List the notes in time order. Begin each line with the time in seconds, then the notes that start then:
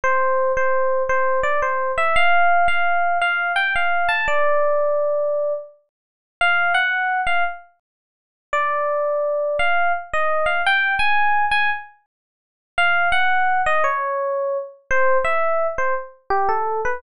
0.04 C5
0.57 C5
1.09 C5
1.43 D5
1.62 C5
1.98 E5
2.16 F5
2.68 F5
3.22 F5
3.56 G5
3.76 F5
4.09 A5
4.28 D5
6.41 F5
6.74 F#5
7.27 F5
8.53 D5
9.59 F5
10.13 D#5
10.46 F5
10.66 G5
10.99 G#5
11.51 G#5
12.78 F5
13.12 F#5
13.66 D#5
13.84 C#5
14.91 C5
15.25 E5
15.78 C5
16.30 G4
16.49 A4
16.85 B4